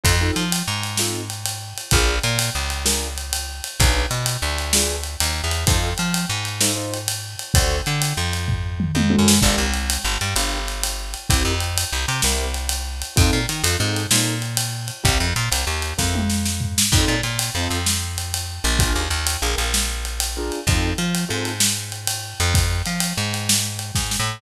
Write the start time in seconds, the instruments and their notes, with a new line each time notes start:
0.04 electric bass (finger) F2, acoustic grand piano C4 D#4 F4 A4, kick, ride
0.21 acoustic grand piano C4 D#4 F4 A4
0.36 electric bass (finger) F3, ride
0.52 ride
0.68 electric bass (finger) G#2
0.83 ride
0.97 acoustic grand piano C4 D#4 F4 A4, snare
1.30 ride
1.46 ride
1.78 ride
1.91 electric bass (finger) A#1, acoustic grand piano D4 F4 G#4 A#4, kick, ride
2.23 electric bass (finger) A#2, ride
2.39 ride
2.55 electric bass (finger) C#2
2.70 ride
2.85 acoustic grand piano D4 F4 G#4 A#4, snare
3.18 ride
3.33 ride
3.64 ride
3.80 electric bass (finger) B1, acoustic grand piano D4 F4 G#4 B4, kick, ride
4.11 electric bass (finger) B2, ride
4.26 ride
4.42 electric bass (finger) D2
4.58 ride
4.73 acoustic grand piano D4 F4 G#4 B4, snare
5.03 ride
5.20 electric bass (finger) D#2, ride
5.44 electric bass (finger) E2
5.51 ride
5.67 electric bass (finger) F2, acoustic grand piano D#4 F4 A4 C5, kick, ride
5.98 electric bass (finger) F3, ride
6.14 ride
6.29 electric bass (finger) G#2
6.45 ride
6.61 acoustic grand piano D#4 F4 A4 C5, snare
6.76 acoustic grand piano D#4 F4 A4 C5
6.94 ride
7.08 ride
7.39 ride
7.54 electric bass (finger) D2, acoustic grand piano D4 F#4 A4 C5, kick, ride
7.86 electric bass (finger) D3, ride
8.02 ride
8.17 electric bass (finger) F2
8.33 ride
8.48 kick, floor tom
8.80 mid tom
8.95 electric bass (finger) F2, high tom
9.10 acoustic grand piano D4 F#4 A4 C5, high tom
9.19 electric bass (finger) F#2
9.28 snare
9.42 electric bass (finger) G1, acoustic grand piano D4 F4 G4 A#4, kick, crash
9.58 electric bass (finger) C2
9.74 ride
9.90 ride
10.04 electric bass (finger) G1
10.21 electric bass (finger) G2, ride
10.36 electric bass (finger) G1, acoustic grand piano D4 F4 G4 A#4, ride
10.68 ride
10.83 ride
11.14 ride
11.30 electric bass (finger) C2, acoustic grand piano C4 E4 G4 A#4, kick, ride
11.45 electric bass (finger) F2
11.60 ride
11.78 ride
11.93 electric bass (finger) C2
12.08 electric bass (finger) C3, ride
12.22 electric bass (finger) C2, acoustic grand piano C4 E4 G4 A#4, snare
12.54 ride
12.69 ride
13.02 ride
13.16 electric bass (finger) F2, acoustic grand piano C4 D#4 F4 A4, kick, ride
13.33 electric bass (finger) A#2
13.49 electric bass (finger) D#3, ride
13.64 electric bass (finger) F2, acoustic grand piano C4 D#4 F4 A4, ride
13.79 electric bass (finger) G#2, acoustic grand piano C4 D#4 F4 A4
13.96 ride
14.11 electric bass (finger) A#2, acoustic grand piano C4 D#4 F4 A4, snare
14.42 ride
14.57 ride
14.88 ride
15.03 electric bass (finger) C2, acoustic grand piano C4 E4 G4 A#4, kick, ride
15.20 electric bass (finger) F2
15.36 electric bass (finger) A#2, ride
15.51 electric bass (finger) C2, ride
15.67 electric bass (finger) D#2
15.82 ride
15.98 electric bass (finger) F2, acoustic grand piano C4 E4 G4 A#4, kick, snare
16.15 high tom
16.30 snare
16.45 snare
16.61 floor tom
16.78 snare
16.92 electric bass (finger) F2, acoustic grand piano C4 D#4 F4 A4, kick, crash
17.08 electric bass (finger) A#2
17.23 electric bass (finger) A#2, ride
17.39 ride
17.55 electric bass (finger) F2, acoustic grand piano C4 D#4 F4 A4
17.70 electric bass (finger) F2, ride
17.86 snare
18.18 ride
18.34 ride
18.64 electric bass (finger) A#1, ride
18.79 acoustic grand piano D4 F4 G#4 A#4, kick, ride
18.95 electric bass (finger) D#2
19.10 electric bass (finger) D#2, ride
19.27 ride
19.42 electric bass (finger) A#1, acoustic grand piano D4 F4 G#4 A#4
19.58 electric bass (finger) A#1, ride
19.74 snare
20.05 ride
20.20 ride
20.37 acoustic grand piano D4 F4 G#4 A#4
20.52 ride
20.67 electric bass (finger) F2, acoustic grand piano C4 D#4 F4 A4, kick, ride
20.98 electric bass (finger) F3, ride
21.15 ride
21.28 electric bass (finger) G#2, acoustic grand piano C4 D#4 F4 A4
21.45 ride
21.60 snare
21.92 ride
22.07 ride
22.40 electric bass (finger) F2, ride
22.54 kick, ride
22.86 electric bass (finger) F3, ride
23.00 ride
23.17 electric bass (finger) G#2
23.34 ride
23.49 snare
23.79 ride
23.95 electric bass (finger) G#2, kick, snare
24.11 snare
24.20 electric bass (finger) A2